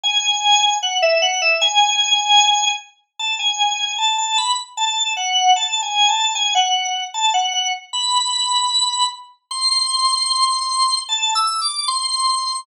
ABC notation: X:1
M:2/4
L:1/16
Q:1/4=76
K:A
V:1 name="Drawbar Organ"
g4 f e f e | g6 z2 | a g3 a a b z | a2 f2 (3a2 g2 a2 |
g f3 a f f z | b6 z2 | [K:Am] c'8 | (3a2 e'2 d'2 c'4 |]